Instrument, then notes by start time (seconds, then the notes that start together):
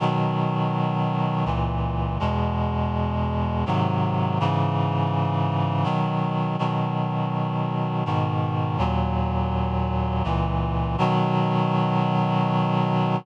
clarinet
0.00 B2 D#3 F#3
1.45 C#2 A#2 E3
2.20 E2 B2 G#3
3.66 G#2 C3 D#3 F#3
4.40 G#2 C#3 E3
5.84 B2 D#3 F#3
6.59 B2 D#3 F#3
8.05 G#2 B2 D#3
8.78 D#2 A#2 F#3
10.24 C#2 A#2 E3
10.98 B2 D#3 F#3